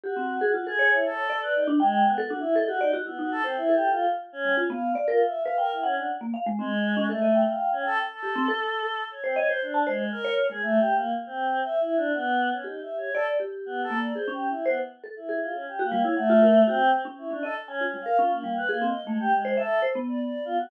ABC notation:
X:1
M:5/4
L:1/16
Q:1/4=119
K:none
V:1 name="Vibraphone"
G C2 ^G | F A ^c4 d3 D g3 A D z A G d ^F | E ^D2 c2 A3 z3 G, F B,2 =d ^A z2 B | g2 ^f3 ^A, =f ^G, C z2 ^C =A ^d =g6 |
z G C A3 z3 c ^d c2 a c z2 ^c2 ^G, | z16 G4 | d2 G4 ^A,2 ^G ^C2 z =c z2 =A z G2 z | z ^F G, E ^f =F ^A z ^F z2 ^C2 C ^d z ^g =F =G, A |
^C2 G,2 ^G =C z A,2 z c e2 c B,6 |]
V:2 name="Choir Aahs"
^F4 | ^F ^G2 E A3 B ^D z ^G,2 (3B,2 F2 E2 ^d F D z | B, ^F A C (3E2 G2 =F2 z2 ^C2 z f2 z (3F2 e2 f2 | ^A E ^C D z4 ^G,4 =A,3 f2 C =A z |
A8 ^c =C ^c =c D2 ^G,2 ^A2 z ^G | (3A,2 G2 ^A,2 z C3 (3e2 E2 D2 B,3 ^C (3^D2 e2 ^c2 | A z3 (3B,2 A2 d2 (3c2 G2 E2 B, z3 E2 F ^C | (3G2 ^A,2 ^c2 =A,4 =C2 z2 E D A z (3^C2 C2 f2 |
F ^A,2 B (3A,2 ^d2 ^G,2 =G ^G,2 =A2 z2 =d d2 F ^F |]